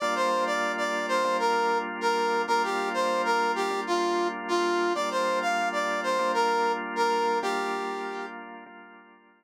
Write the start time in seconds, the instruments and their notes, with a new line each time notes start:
0.00 drawbar organ G3 A#3 D4 F4, brass section D5
0.15 brass section C5
0.46 brass section D5
0.77 brass section D5
1.09 brass section C5
1.24 drawbar organ G3 A#3 D4 F4
1.39 brass section A#4
2.01 brass section A#4
2.48 drawbar organ G3 A#3 D4 F4, brass section A#4
2.63 brass section G4
2.94 brass section C5
3.25 brass section A#4
3.56 brass section G4
3.70 drawbar organ G3 A#3 D4 F4
3.87 brass section F4
4.48 brass section F4
4.95 drawbar organ G3 A#3 D4 F4, brass section D5
5.10 brass section C5
5.41 brass section F5
5.72 brass section D5
6.03 brass section C5
6.19 drawbar organ G3 A#3 D4 F4
6.34 brass section A#4
6.96 brass section A#4
7.42 drawbar organ G3 A#3 D4 F4, brass section G4
8.66 drawbar organ G3 A#3 D4 F4